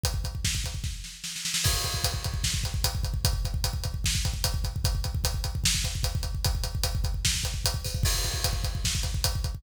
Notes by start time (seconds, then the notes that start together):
0.04 kick, closed hi-hat
0.14 kick
0.24 kick, closed hi-hat
0.35 kick
0.45 kick, snare
0.55 kick
0.64 kick, closed hi-hat
0.74 kick
0.84 kick, snare
1.04 snare
1.24 snare
1.36 snare
1.45 snare
1.54 snare
1.64 kick, crash
1.73 kick
1.84 kick, closed hi-hat
1.94 kick
2.04 kick, closed hi-hat
2.14 kick
2.24 kick, closed hi-hat
2.34 kick
2.44 kick, snare
2.54 kick
2.64 kick, closed hi-hat
2.74 kick
2.84 kick, closed hi-hat
2.95 kick
3.04 kick, closed hi-hat
3.14 kick
3.25 kick, closed hi-hat
3.33 kick
3.45 kick, closed hi-hat
3.54 kick
3.64 kick, closed hi-hat
3.73 kick
3.84 kick, closed hi-hat
3.94 kick
4.04 kick, snare
4.15 kick
4.25 kick, closed hi-hat
4.34 kick
4.44 kick, closed hi-hat
4.54 kick
4.64 kick, closed hi-hat
4.76 kick
4.84 kick, closed hi-hat
4.95 kick
5.04 kick, closed hi-hat
5.15 kick
5.24 kick, closed hi-hat
5.34 kick
5.44 kick, closed hi-hat
5.55 kick
5.64 kick, snare
5.75 kick
5.84 kick, closed hi-hat
5.95 kick
6.03 kick, closed hi-hat
6.15 kick
6.23 kick, closed hi-hat
6.35 kick
6.45 kick, closed hi-hat
6.55 kick
6.64 kick, closed hi-hat
6.75 kick
6.84 kick, closed hi-hat
6.95 kick
7.04 kick, closed hi-hat
7.14 kick
7.25 kick, snare
7.34 kick
7.44 kick, closed hi-hat
7.54 kick
7.65 kick, closed hi-hat
7.74 kick
7.85 kick, open hi-hat
7.95 kick
8.03 kick, crash
8.14 kick
8.24 kick, closed hi-hat
8.34 kick
8.44 kick, closed hi-hat
8.53 kick
8.64 kick, closed hi-hat
8.75 kick
8.85 kick, snare
8.95 kick
9.03 kick, closed hi-hat
9.14 kick
9.24 kick, closed hi-hat
9.35 kick
9.44 kick, closed hi-hat
9.55 kick